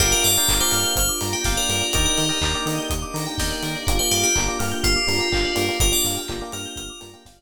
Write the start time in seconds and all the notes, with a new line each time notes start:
0.00 G1 A#3 D4 F4 G4 A#4 D5 F5 G5, kick, crash
0.12 A#4 D5
0.24 G2 D5 F5, open hi-hat
0.36 A#4 D5 F5 G5
0.48 G1 A#4 D5 F5 G5 A#5, kick, clap
0.60 A#4 C5 D5 F5 G5 D6
0.71 G2 F6, open hi-hat
0.85 G6
0.96 G1 C5 F6, kick, closed hi-hat
1.09 D6
1.21 G2 A#5, open hi-hat
1.33 G4 G5
1.44 G1 A#4 D5 F5 G5, kick, snare
1.57 A#4 D5
1.69 G2 A#4, open hi-hat
1.81 D5
1.93 D#2 A#3 D4 D#4 G4 A#4 D5 D#5 G5, kick, closed hi-hat
2.05 A#4 D5
2.17 D#3 D#5, open hi-hat
2.29 A#4 D5 D#5 G5
2.41 D#2 A#4 D5 D#5 G5 A#5, kick, clap
2.54 A#4 D5 D#5 G5 D6
2.66 D#3 D#6, open hi-hat
2.78 G6
2.90 D#2 D#6, kick, closed hi-hat
3.02 D6
3.14 D#3 A#5, open hi-hat
3.26 G5
3.38 D#2 A#4 D5 D#5 G5, kick, snare
3.51 D5
3.63 D#3 A#4, open hi-hat
3.75 D5
3.87 G1 A#3 D4 F4 G4 A#4, kick, closed hi-hat
3.99 A#3 D4 F4 G4 C5 D5
4.11 G2 G4 F5, open hi-hat
4.23 G4 G5
4.35 G1 A#3 D4 F4 G4 A#5, kick, clap
4.48 A#3 D4 F4 G4 D6
4.59 G2 A#3 D4 F4 G4 F6, open hi-hat
4.72 G6
4.84 G1 F4 F6, kick, closed hi-hat
4.96 D6
5.07 G2 A#3 D4 F4 G4 A#5, open hi-hat
5.18 A#3 D4 F4 G4 G5
5.32 G1 A#3 D4 F4 G4 F5, kick, clap
5.45 D5
5.55 G2 A#3 D4 F4 G4 A#4, open hi-hat
5.69 A#3 D4 F4 G4 D5
5.80 G1 A#3 D4 F4 G4 A#4, kick, closed hi-hat
5.92 A#3 D4 F4 G4 D5
6.04 G2 F5, open hi-hat
6.17 G5
6.28 G1 A#3 D4 F4 G4 A#5, kick, clap
6.41 A#3 D4 F4 G4 D6
6.52 G2 A#3 D4 F4 G4 A#4 F6, open hi-hat
6.66 G6
6.76 G1 A#4 F6, kick, closed hi-hat
6.90 D6
7.00 G2 A#3 D4 F4 G4 A#5, open hi-hat
7.13 A#3 D4 F4 G4 G5
7.25 G1 A#3 D4 F4 G4 F5, kick, snare
7.38 D5